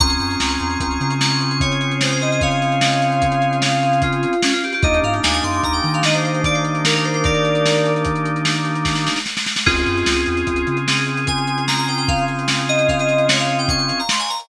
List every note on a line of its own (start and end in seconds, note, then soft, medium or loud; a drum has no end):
0.00 0.17 C#2 loud
0.00 4.34 C4 medium
0.00 4.34 C#4 loud
0.00 4.34 F4 medium
0.00 4.34 G#4 medium
0.00 1.14 A#5 medium
0.00 1.14 C#6 medium
0.00 kick loud
0.00 closed hi-hat loud
0.10 closed hi-hat medium
0.20 0.37 F#2 medium
0.20 closed hi-hat medium
0.31 closed hi-hat medium
0.40 0.57 C#2 medium
0.40 snare loud
0.50 closed hi-hat medium
0.60 0.78 E2 medium
0.60 closed hi-hat medium
0.70 closed hi-hat medium
0.80 0.98 C#2 medium
0.80 kick medium
0.80 closed hi-hat loud
0.91 closed hi-hat medium
1.00 4.26 C#3 medium
1.00 closed hi-hat medium
1.10 closed hi-hat medium
1.21 1.58 C#6 medium
1.21 snare medium
1.31 closed hi-hat medium
1.41 closed hi-hat medium
1.51 closed hi-hat medium
1.60 1.93 C#5 loud
1.60 kick medium
1.60 closed hi-hat loud
1.72 closed hi-hat medium
1.81 closed hi-hat medium
1.91 closed hi-hat medium
2.01 2.11 C5 medium
2.01 snare loud
2.11 2.22 C5 loud
2.11 closed hi-hat medium
2.21 2.31 D#5 medium
2.21 closed hi-hat medium
2.31 2.41 D#5 medium
2.31 closed hi-hat medium
2.41 3.56 C#5 medium
2.41 3.56 F5 loud
2.41 kick medium
2.41 closed hi-hat medium
2.51 closed hi-hat medium
2.62 closed hi-hat medium
2.72 closed hi-hat medium
2.81 snare loud
2.92 closed hi-hat medium
3.02 closed hi-hat medium
3.12 closed hi-hat medium
3.22 kick medium
3.22 closed hi-hat loud
3.32 closed hi-hat medium
3.42 closed hi-hat medium
3.53 closed hi-hat medium
3.62 4.00 F5 loud
3.62 snare loud
3.72 closed hi-hat medium
3.83 closed hi-hat medium
3.93 closed hi-hat medium
4.02 4.41 F4 medium
4.02 kick medium
4.02 closed hi-hat loud
4.13 closed hi-hat medium
4.23 closed hi-hat medium
4.33 closed hi-hat medium
4.42 4.53 C#4 medium
4.42 snare loud
4.53 4.62 F4 loud
4.53 closed hi-hat medium
4.64 4.73 G4 medium
4.64 closed hi-hat medium
4.73 4.83 G4 loud
4.73 closed hi-hat medium
4.83 5.00 D#2 medium
4.83 9.19 A#3 medium
4.83 9.19 D4 medium
4.83 9.19 D#4 medium
4.83 9.19 G4 loud
4.83 4.99 D#5 loud
4.83 kick loud
4.83 closed hi-hat medium
4.94 closed hi-hat medium
5.03 5.21 G#2 medium
5.03 5.13 F5 medium
5.03 closed hi-hat medium
5.14 closed hi-hat medium
5.23 5.41 D#2 medium
5.23 5.33 G#5 medium
5.23 snare loud
5.33 5.43 G#5 loud
5.33 closed hi-hat medium
5.43 5.61 F#2 medium
5.43 5.61 C6 medium
5.43 closed hi-hat medium
5.54 closed hi-hat medium
5.63 5.81 D#2 medium
5.63 5.73 A#5 medium
5.63 kick medium
5.63 closed hi-hat medium
5.73 5.89 G5 medium
5.73 closed hi-hat medium
5.84 9.09 D#3 medium
5.84 closed hi-hat medium
5.94 6.03 F5 medium
5.94 closed hi-hat medium
6.03 6.14 D#5 medium
6.03 snare loud
6.13 6.23 C5 medium
6.13 closed hi-hat medium
6.24 6.41 C5 medium
6.24 closed hi-hat medium
6.34 closed hi-hat medium
6.44 6.55 D5 loud
6.44 kick medium
6.44 closed hi-hat loud
6.54 6.64 C5 medium
6.54 closed hi-hat medium
6.65 closed hi-hat medium
6.75 closed hi-hat medium
6.85 6.94 A#4 medium
6.85 snare loud
6.95 7.05 A#4 loud
6.95 closed hi-hat medium
7.04 7.14 C5 medium
7.04 closed hi-hat medium
7.14 7.24 C5 medium
7.14 closed hi-hat medium
7.24 7.92 A#4 medium
7.24 7.92 D5 loud
7.24 kick loud
7.24 closed hi-hat medium
7.34 closed hi-hat medium
7.45 closed hi-hat medium
7.55 closed hi-hat medium
7.66 snare medium
7.76 closed hi-hat medium
7.85 closed hi-hat medium
7.96 closed hi-hat medium
8.05 kick medium
8.05 closed hi-hat loud
8.16 closed hi-hat medium
8.25 closed hi-hat medium
8.36 closed hi-hat medium
8.45 snare loud
8.56 closed hi-hat medium
8.65 closed hi-hat medium
8.75 closed hi-hat medium
8.85 kick medium
8.85 snare medium
8.95 snare medium
9.07 snare medium
9.16 snare medium
9.26 snare medium
9.37 snare medium
9.46 snare medium
9.56 snare medium
9.66 9.84 C#2 loud
9.66 14.01 C4 medium
9.66 14.01 C#4 medium
9.66 10.77 F4 medium
9.66 14.01 F4 medium
9.66 10.77 G#4 loud
9.66 14.01 G#4 loud
9.66 kick loud
9.66 crash loud
9.77 closed hi-hat medium
9.86 10.04 F#2 medium
9.86 closed hi-hat medium
9.97 closed hi-hat medium
10.06 10.24 C#2 medium
10.06 snare loud
10.16 closed hi-hat medium
10.26 10.44 E2 medium
10.26 closed hi-hat medium
10.37 closed hi-hat medium
10.47 10.64 C#2 medium
10.47 kick medium
10.47 closed hi-hat medium
10.56 closed hi-hat medium
10.67 13.92 C#3 medium
10.67 closed hi-hat medium
10.77 closed hi-hat medium
10.87 11.26 G#4 medium
10.87 snare loud
10.97 closed hi-hat medium
11.07 closed hi-hat medium
11.17 closed hi-hat medium
11.27 11.63 G#5 medium
11.27 kick medium
11.27 closed hi-hat loud
11.38 closed hi-hat medium
11.47 closed hi-hat medium
11.58 closed hi-hat medium
11.67 11.77 A#5 medium
11.67 snare medium
11.77 11.87 A#5 loud
11.77 closed hi-hat medium
11.88 11.97 G5 medium
11.88 closed hi-hat medium
11.98 12.08 G5 loud
11.98 closed hi-hat medium
12.08 12.25 F5 loud
12.08 kick loud
12.08 closed hi-hat medium
12.18 closed hi-hat medium
12.28 closed hi-hat medium
12.39 closed hi-hat medium
12.48 snare loud
12.58 closed hi-hat medium
12.69 12.88 D#5 loud
12.69 closed hi-hat medium
12.79 closed hi-hat medium
12.88 12.98 F5 medium
12.88 kick medium
12.88 closed hi-hat medium
12.99 13.26 D#5 medium
12.99 closed hi-hat medium
13.09 closed hi-hat medium
13.18 closed hi-hat medium
13.28 13.38 C#5 loud
13.28 snare loud
13.39 13.58 F5 medium
13.39 closed hi-hat medium
13.49 closed hi-hat medium
13.59 13.68 G5 loud
13.59 closed hi-hat medium
13.68 13.98 C#6 loud
13.68 kick medium
13.68 closed hi-hat loud
13.79 closed hi-hat medium
13.89 closed hi-hat medium
13.99 14.09 A#5 medium
13.99 closed hi-hat medium
14.09 14.20 C6 loud
14.09 snare loud
14.19 14.29 G#5 loud
14.19 closed hi-hat medium
14.29 14.39 A#5 medium
14.29 closed hi-hat medium
14.40 closed hi-hat medium